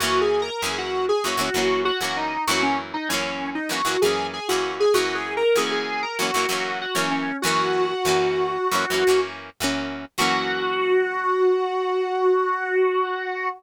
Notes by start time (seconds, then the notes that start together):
0.00 F#2 E3 A#3 F#4
0.04 C#4
0.21 G#4
0.42 A#4
0.62 F#2 E3 A#3 C#4 G#4
0.78 F#4
1.09 G#4
1.24 F#2 E3 A#3 C#4 F#4
1.37 F#2 E3 A#3 C#4
1.54 F#2 E3 A#3 C#4
1.85 F#4
2.01 F#2 E3 A#3 C#4 F#4
2.17 D#4
2.47 F#2 E3 A#3 C#4 F#4
2.63 C#4
2.94 D#4
3.09 F#2 E3 A#3 C#4
3.14 C#4
3.55 D#4
3.69 F#2 E3 A#3 C#4 F#4
3.85 F#2 E3 A#3 C#4
4.02 F#2 E3 A#3 G#4
4.06 C#4
4.33 G#4
4.49 F#2 E3 A#3 F#4
4.53 C#4
4.80 G#4
4.94 F#2 E3 A#3 C#4 F#4
5.15 G#4
5.37 A#4
5.56 F#2 E3 A#3 C#4 G#4
5.71 G#4
6.03 A#4
6.19 F#2 E3 A#3 C#4 F#4
6.34 F#2 E3 A#3 C#4
6.49 F#2 E3 A#3 C#4
6.81 F#4
6.95 F#2 E3 A#3 C#4
7.11 C#4
7.42 F#2 E3 A#3 F#4
7.47 C#4
8.05 F#2 E3 A#3 C#4
8.71 F#2 E3 A#3 C#4
8.90 F#2 E3 A#3 C#4
9.07 F#2 E3 A#3 C#4
9.60 F#2 E3 A#3 C#4
10.18 F#2 E3 A#3 C#4 F#4